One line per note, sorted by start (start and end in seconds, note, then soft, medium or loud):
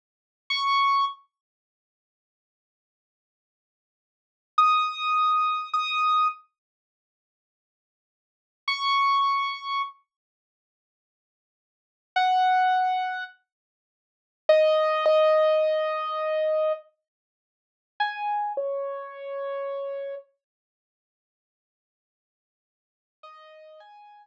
0.50 1.05 C#6 medium
4.58 5.70 D#6 medium
5.73 6.28 D#6 soft
8.68 9.82 C#6 medium
12.16 13.24 F#5 medium
14.49 15.05 D#5 medium
15.06 16.72 D#5 medium
18.00 18.53 G#5 medium
18.57 20.15 C#5 medium
23.23 23.81 D#5 medium
23.80 24.27 G#5 medium